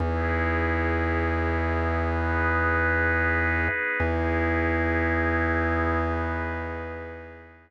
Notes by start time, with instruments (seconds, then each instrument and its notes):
0.00 drawbar organ E2, pad 2 (warm) B3 D#4 E4 G#4
2.00 pad 2 (warm) B3 D#4 G#4 B4
4.00 drawbar organ E2, pad 2 (warm) B3 D#4 E4 G#4
6.00 pad 2 (warm) B3 D#4 G#4 B4